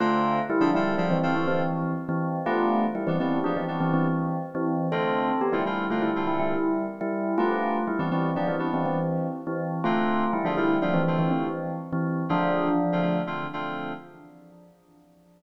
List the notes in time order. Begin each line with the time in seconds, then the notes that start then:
0.00 D3 A3 C4 F4 A4
0.50 G3 E4
0.60 D3 F3 C4 D4 F4 A4
0.74 D3 G3 C4 E4 F4 A4
0.98 D3 F3 C4 D4 F4 A4
1.10 E3 C4
1.23 D3 C4 F4 A4
1.36 E3 C4
1.48 E3 C4
2.09 E3 C4
2.46 G3 A3 B3 D4 F4
2.95 G3 E4
3.07 E3 G3 B3 C4 D4
3.20 E3 G3 B3 C4 D4
3.44 F3 G3 B3 D4
3.56 E3 C4
3.68 G3 B3 D4
3.80 E3 C4
3.93 E3 C4
4.55 E3 C4
4.92 D3 A3 C4 F4 A4
5.41 B3 G4
5.53 D3 G3 A3 C4 E4 F4
5.66 D3 G3 A3 C4 E4 F4
5.90 D3 A3 C4 F4
6.02 G3 E4
6.16 D3 A3 C4 F4
6.27 G3 E4
6.40 G3 E4
7.01 G3 E4
7.38 G3 A3 B3 D4 F4
7.87 G3 E4
7.99 E3 G3 B3 C4 D4
8.11 E3 G3 B3 C4 D4
8.36 F3 G3 B3 D4
8.48 E3 C4
8.59 G3 B3 D4
8.74 E3 C4
8.86 E3 C4
9.47 E3 C4
9.84 D3 A3 C4 F4
10.33 G3 E4
10.44 D3 F3 A3 C4 D4 F4
10.57 D3 G3 A3 C4 E4 F4
10.82 D3 F3 A3 C4 D4 F4
10.94 E3 C4
11.07 D3 A3 C4 F4
11.19 E3 C4
11.31 E3 C4
11.93 E3 C4
12.29 D3 F3 A3 C4 D4 F4
12.92 D3 A3 C4 F4
13.02 D3 A3 C4 F4
13.27 D3 A3 C4 F4
13.53 D3 A3 C4 F4